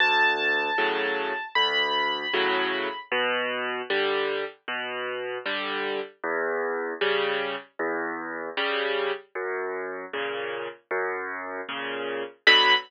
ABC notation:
X:1
M:4/4
L:1/8
Q:1/4=77
K:Bm
V:1 name="Acoustic Grand Piano"
a4 b4 | z8 | z8 | z8 |
b2 z6 |]
V:2 name="Acoustic Grand Piano" clef=bass
D,,2 [A,,C,F,]2 D,,2 [A,,C,F,]2 | B,,2 [D,G,]2 B,,2 [D,G,]2 | E,,2 [C,G,]2 E,,2 [C,G,]2 | F,,2 [^A,,C,]2 F,,2 [A,,C,]2 |
[B,,D,F,]2 z6 |]